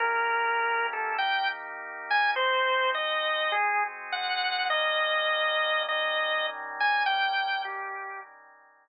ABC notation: X:1
M:4/4
L:1/8
Q:"Swing" 1/4=102
K:Eb
V:1 name="Drawbar Organ"
B3 =A g z2 _a | c2 e2 A z _g2 | e4 e2 z a | g2 G2 z4 |]
V:2 name="Drawbar Organ"
[E,B,_DG]4 [E,B,EG]4 | [A,CE_G]4 [A,CGA]4 | [E,G,B,_D]4 [E,G,DE]4 | [E,G,B,_D]4 [E,G,DE]4 |]